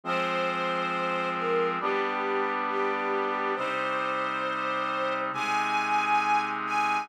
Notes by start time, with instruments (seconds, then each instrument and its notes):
0.04 brass section F3 G#3 C4, string ensemble 1 C5
1.36 string ensemble 1 A#4
1.80 brass section G3 B3 D4, string ensemble 1 G4
2.69 string ensemble 1 G4
3.56 brass section C3 G3 D#4, string ensemble 1 C5
5.32 brass section C3 G#3 D#4, string ensemble 1 G#5
6.66 string ensemble 1 G#5